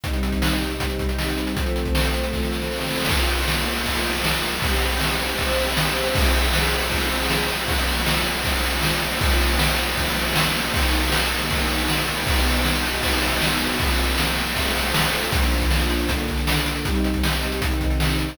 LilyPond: <<
  \new Staff \with { instrumentName = "String Ensemble 1" } { \time 4/4 \key bes \major \tempo 4 = 157 <c g ees'>1 | <f a c'>1 | \key bes \minor <bes des' f'>2 <f bes f'>2 | <c' e' g'>2 <c' g' c''>2 |
<f c' aes'>1 | <bes, f des'>1 | <bes, f des'>1 | <ees ges bes>1 |
<ces ges ees'>1 | <f bes c'>2 <f a c'>2 | \key bes \major <bes, f d'>2 <bes, d d'>2 | <c g ees'>2 <c ees ees'>2 | }
  \new DrumStaff \with { instrumentName = "Drums" } \drummode { \time 4/4 <hh bd>16 hh16 hh16 <hh bd>16 sn16 hh16 hh16 hh16 <hh bd>16 hh16 <hh bd>16 hh16 sn16 hh16 hh16 hh16 | <hh bd>16 hh16 hh16 <hh bd>16 sn16 hh16 hh16 hh16 <bd sn>16 sn16 sn16 sn16 sn32 sn32 sn32 sn32 sn32 sn32 sn32 sn32 | <cymc bd>16 cymr16 cymr16 cymr16 sn16 cymr16 cymr16 cymr16 <bd cymr>16 cymr16 cymr16 cymr16 sn16 cymr16 cymr16 cymr16 | <bd cymr>16 cymr16 cymr16 cymr16 sn16 cymr16 cymr16 cymr16 <bd cymr>16 cymr16 cymr16 cymr16 sn16 cymr16 cymr16 cymr16 |
<bd cymr>16 cymr16 cymr16 cymr16 sn16 cymr16 cymr16 cymr16 <bd cymr>16 cymr16 cymr16 cymr16 sn16 cymr16 cymr16 cymr16 | <bd cymr>16 cymr16 cymr16 cymr16 sn16 cymr16 cymr16 cymr16 <bd cymr>16 cymr16 cymr16 cymr16 sn16 cymr16 cymr16 cymr16 | <bd cymr>16 cymr16 cymr16 cymr16 sn16 cymr16 cymr16 cymr16 <bd cymr>16 cymr16 cymr16 cymr16 sn16 cymr16 cymr16 cymr16 | <bd cymr>16 cymr16 cymr16 cymr16 sn16 cymr16 cymr16 cymr16 <bd cymr>16 cymr16 cymr16 cymr16 sn16 cymr16 cymr16 cymr16 |
<bd cymr>16 cymr16 cymr16 cymr16 sn16 cymr16 cymr16 cymr16 <bd cymr>16 cymr16 cymr16 cymr16 sn16 cymr16 cymr16 cymr16 | <bd cymr>16 cymr16 cymr16 cymr16 sn16 cymr16 cymr16 cymr16 <bd cymr>16 cymr16 cymr16 cymr16 sn16 cymr16 cymr16 cymr16 | <hh bd>16 hh16 hh16 <hh bd>16 sn16 hh16 hh16 hh16 <hh bd>16 hh16 <hh bd>16 hh16 sn16 hh16 hh16 hh16 | <hh bd>16 hh16 hh16 <hh bd>16 sn16 hh16 hh16 hh16 <hh bd>16 hh16 <hh bd>16 hh16 sn16 hh16 hh16 hho16 | }
>>